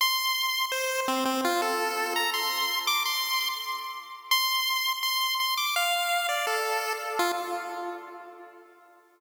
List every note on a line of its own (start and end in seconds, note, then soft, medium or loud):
0.01 0.66 C6 loud
0.72 1.01 C5 medium
1.08 1.24 C4 medium
1.25 1.41 C4 loud
1.45 1.61 F4 loud
1.62 2.14 A4 loud
2.16 2.30 A#5 medium
2.34 2.79 C6 medium
2.87 3.03 D6 loud
3.05 3.49 C6 loud
4.31 4.93 C6 loud
5.03 5.35 C6 loud
5.40 5.55 C6 medium
5.57 5.75 D6 medium
5.76 6.27 F5 loud
6.29 6.46 D5 medium
6.47 6.93 A4 medium
7.19 7.32 F4 loud